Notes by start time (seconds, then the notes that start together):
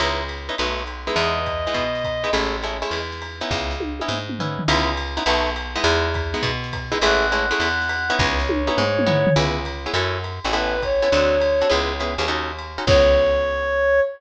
0.00 C#2 B3 C#4 D#4 E4, ride
0.29 hi-hat pedal, ride
0.49 B3 C#4 D#4 E4, ride
0.58 B1 A3 B3 D#4 F#4, ride
0.77 snare
0.87 hi-hat pedal, ride
1.07 G#3 B3 D#4 E4, ride
1.16 E2 D#5, ride
1.46 kick, hi-hat pedal, ride
1.67 G#3 B3 D#4 E4, ride
1.74 B2, kick, ride
1.95 snare
2.04 kick, hi-hat pedal, ride
2.24 G#3 B3 D#4 E4, ride
2.33 A1 G#3 A3 C#4 E4, ride
2.63 G#3 A3 C#4 E4, hi-hat pedal, ride
2.82 G#3 A3 C#4 E4, ride
2.91 E2, ride
3.12 snare
3.22 hi-hat pedal, ride
3.41 B3 C#4 D#4 E4, ride
3.51 C#2, kick, snare
3.71 snare
3.80 high tom
4.00 B3 C#4 D#4 E4, high tom
4.08 G#2, mid tom
4.29 mid tom
4.39 B3 C#4 D#4 E4, floor tom
4.59 floor tom
4.68 C#2 B3 C#4 D#4 E4, ride
4.97 hi-hat pedal, ride
5.17 B3 C#4 D#4 E4, ride
5.26 B1 A3 B3 D#4 F#4, ride
5.46 snare
5.56 hi-hat pedal, ride
5.75 G#3 B3 D#4 E4, ride
5.84 E2, ride
6.14 kick, hi-hat pedal, ride
6.34 G#3 B3 D#4 E4, ride
6.43 B2, kick, ride
6.64 snare
6.73 kick, hi-hat pedal, ride
6.92 G#3 B3 D#4 E4, ride
7.01 A1 G#3 A3 C#4 E4 F#5, ride
7.32 G#3 A3 C#4 E4, hi-hat pedal, ride
7.51 G#3 A3 C#4 E4, ride
7.60 E2, ride
7.81 snare
7.89 hi-hat pedal, ride
8.10 B3 C#4 D#4 E4, ride
8.19 C#2 C#5, kick, snare
8.40 snare
8.49 high tom
8.67 B3 C#4 D#4 E4, high tom
8.77 G#2, mid tom
8.99 mid tom
9.06 B3 C#4 D#4 E4, floor tom
9.27 floor tom
9.36 C#2 B3 C#4 E4 G#4, ride
9.65 hi-hat pedal, ride
9.86 B3 C#4 E4 G#4, ride
9.94 F#2 C#4 E4 F#4 A4, ride
10.24 hi-hat pedal, ride
10.44 A1 C#4 E4 F#4 A4, ride
10.53 B3 C#4 E4 A4 B4, ride
10.83 C#5, kick, hi-hat pedal, ride
11.02 B3 C#4 E4 A4, ride
11.12 D2 C4 D4 F#4 A4, ride
11.41 hi-hat pedal, ride
11.61 C4 D4 F#4 A4, ride
11.70 C#2 B3 C#4 E4 G#4, ride
12.00 B3 C#4 E4 G#4, hi-hat pedal, ride
12.18 D#2 B3 C#4 E4 G#4, ride
12.28 C#4 D#4 F#4 A4, ride
12.59 hi-hat pedal, ride
12.78 C#4 D#4 F#4 A4, ride
12.87 C#2 B3 C#4 E4 G#4 C#5, kick, crash